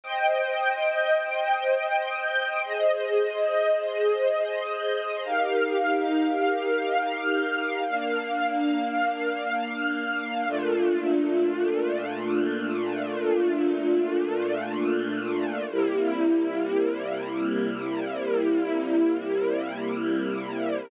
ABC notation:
X:1
M:3/4
L:1/8
Q:1/4=69
K:Eb
V:1 name="String Ensemble 1"
[ceg]6 | [Ace]6 | [EGBf]6 | [B,Df]6 |
[K:F] [B,,A,DF]6- | [B,,A,DF]6 | [C,G,B,E]6- | [C,G,B,E]6 |]